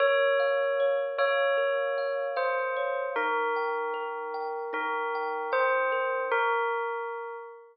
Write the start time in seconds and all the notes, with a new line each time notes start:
0.00 A#4 C#5
0.39 F5
0.80 C#5
1.18 C#5 F5
1.57 A#4
1.98 F5
2.36 C5 F5
2.76 C#5
3.16 D#4 A#4
3.56 G5
3.94 A#4
4.34 G5
4.73 D#4 A#4
5.15 G5
5.52 C5 G5
5.92 A#4
6.32 A#4